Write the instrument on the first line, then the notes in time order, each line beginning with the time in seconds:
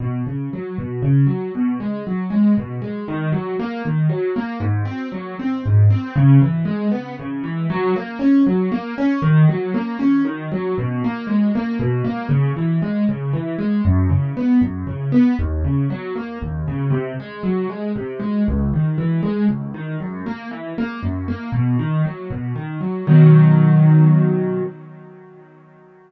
acoustic grand piano
0.00 B2
0.26 C#3
0.53 F#3
0.78 B2
1.02 C#3
1.26 F#3
1.55 B2
1.80 G#3
2.07 F#3
2.30 G#3
2.57 B2
2.82 G#3
3.08 D#3
3.32 F#3
3.59 A#3
3.85 D#3
4.09 F#3
4.36 A#3
4.60 G#2
4.85 C4
5.12 F#3
5.39 C4
5.65 G#2
5.90 C4
6.15 C#3
6.42 E3
6.65 G#3
6.91 B3
7.19 C#3
7.44 E3
7.70 F#3
7.96 A#3
8.19 C#4
8.46 F#3
8.72 A#3
8.98 C#4
9.22 D#3
9.49 F#3
9.74 A#3
9.99 C#4
10.25 D#3
10.51 F#3
10.78 B2
11.04 A#3
11.27 G#3
11.55 A#3
11.79 B2
12.04 A#3
12.29 C#3
12.56 E3
12.82 G#3
13.09 C#3
13.33 E3
13.58 G#3
13.85 F#2
14.09 C#3
14.37 B3
14.61 F#2
14.87 C#3
15.12 B3
15.39 D#2
15.64 C#3
15.90 F#3
16.15 A#3
16.42 D#2
16.68 C#3
16.90 C3
17.20 G#3
17.43 F#3
17.69 G#3
17.96 C3
18.19 G#3
18.48 C#2
18.74 D#3
18.98 E3
19.23 G#3
19.48 C#2
19.74 D#3
20.00 F#2
20.26 A#3
20.51 E3
20.78 A#3
21.03 F#2
21.28 A#3
21.52 B2
21.79 D#3
22.05 F#3
22.30 B2
22.55 D#3
22.81 F#3
23.07 B2 D#3 F#3